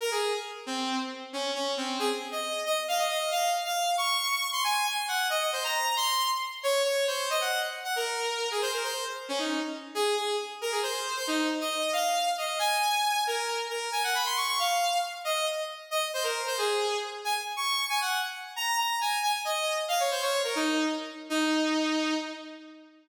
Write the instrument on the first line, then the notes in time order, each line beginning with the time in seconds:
lead 2 (sawtooth)
0.01 A#4
0.11 G#4
0.66 C4
1.33 C#4
1.55 C#4
1.77 C4
1.99 G#4
2.32 D#5
2.66 D#5
2.88 F5
2.98 D#5
3.10 D#5
3.31 F5
3.65 F5
3.97 C#6
4.52 C6
4.64 G#5
4.86 G#5
5.08 F#5
5.30 D#5
5.41 D#5
5.53 C5
5.64 A#5
5.96 C6
6.63 C#5
6.84 C#5
7.07 C5
7.30 D#5
7.41 F#5
7.84 F#5
7.96 A#4
8.51 G#4
8.62 C5
8.73 A#4
8.84 C5
9.28 C#4
9.38 D#4
9.95 G#4
10.17 G#4
10.61 A#4
10.71 G#4
10.83 C5
11.16 C5
11.27 D#4
11.61 D#5
11.93 F5
12.38 D#5
12.59 G#5
13.27 A#4
13.70 A#4
13.92 G#5
14.03 F#5
14.15 B5
14.25 C6
14.36 C#6
14.48 C#6
14.59 F5
15.24 D#5
15.91 D#5
16.14 C5
16.23 A#4
16.46 C5
16.58 G#4
17.24 G#5
17.56 C#6
17.89 G#5
18.01 F#5
18.56 A#5
18.78 A#5
19.01 G#5
19.23 G#5
19.45 D#5
19.88 F5
20.00 C#5
20.11 C5
20.22 C#5
20.44 A#4
20.55 D#4
21.30 D#4